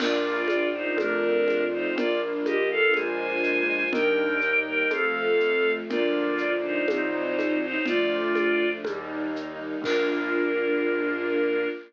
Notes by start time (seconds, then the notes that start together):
0.00 A#1 A#3 D4 F4 A#4 D5, crash, low conga, shaker
0.48 D4 F4 D5, high conga, shaker
0.74 D#4 C5
0.96 F2 A3 C4 D4 F4 A#4, high conga, shaker
1.47 F4, high conga, shaker
1.72 D#4 C5
1.95 A#1 A#3 D4 F4 A#4 D5, low conga, shaker
2.44 D4 G4 D#5, high conga, shaker
2.71 A4 F5
2.94 A#1 G#3 A#3 D4 F4 C5 G#5, high conga, shaker
3.43 shaker
3.93 D#2 G3 A#3 D4 D#4 A#4 G5, low conga, shaker
4.41 D#4, shaker
4.66 A#4 G5
4.90 F2 F3 A3 C4 A4 F5, high conga, shaker
5.40 A3, shaker
5.90 D2 F3 A#3 D4 F4 A#4 D5, low conga, shaker
6.38 F4 D5, shaker
6.64 D#4 C5
6.88 C2 F#3 C4 D#4 C5, high conga, shaker
7.39 high conga, shaker
7.63 D#4 C5
7.86 D2 F3 A3 D4 F4 D5, low conga, shaker
8.35 D4, high conga, shaker
8.84 D#2 G3 A#3 D#4, high conga, shaker
9.35 D#4, shaker
9.82 A#1 A#3 D4 F4 A#4, kick, crash